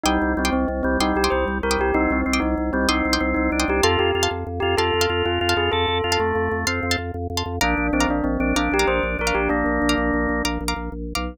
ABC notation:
X:1
M:12/8
L:1/16
Q:3/8=127
K:Cdor
V:1 name="Tubular Bells"
E4 C2 C2 C2 C2 E2 G2 c2 z2 B2 G2 | E2 C4 E4 C2 E6 E4 G2 | A2 G4 z4 G2 A6 F4 ^G2 | A12 z12 |
D4 C2 D2 C2 C2 D2 G2 c2 z2 B2 G2 | D14 z10 |]
V:2 name="Drawbar Organ"
G,4 G,2 z4 G,2 G,4 G,4 G,4 | C4 C2 z4 G,2 C4 C4 D4 | F4 F2 z4 F2 F4 F4 F4 | A4 F2 A,6 C4 z8 |
D4 D2 z4 D2 D4 D4 D4 | B,12 z12 |]
V:3 name="Pizzicato Strings"
[gc'd'e']5 [gc'd'e']7 [gc'd'e']3 [gc'd'e']6 [gc'd'e']3- | [gc'd'e']5 [gc'd'e']7 [gc'd'e']3 [gc'd'e']6 [gc'd'e']3 | [fac']5 [fac']7 [fac']3 [fac']6 [fac']3- | [fac']5 [fac']7 [fac']3 [fac']6 [fac']3 |
[fbd']5 [fbd']7 [fbd']3 [fbd']6 [fbd']3- | [fbd']5 [fbd']7 [fbd']3 [fbd']6 [fbd']3 |]
V:4 name="Drawbar Organ" clef=bass
C,,2 C,,2 C,,2 C,,2 C,,2 C,,2 C,,2 C,,2 C,,2 C,,2 C,,2 C,,2 | C,,2 C,,2 C,,2 C,,2 C,,2 C,,2 C,,2 C,,2 C,,2 C,,2 C,,2 C,,2 | F,,2 F,,2 F,,2 F,,2 F,,2 F,,2 F,,2 F,,2 F,,2 F,,2 F,,2 F,,2 | F,,2 F,,2 F,,2 F,,2 F,,2 F,,2 F,,2 F,,2 F,,2 F,,2 F,,2 F,,2 |
B,,,2 B,,,2 B,,,2 B,,,2 B,,,2 B,,,2 B,,,2 B,,,2 B,,,2 B,,,2 B,,,2 B,,,2 | B,,,2 B,,,2 B,,,2 B,,,2 B,,,2 B,,,2 B,,,2 B,,,2 B,,,2 B,,,3 =B,,,3 |]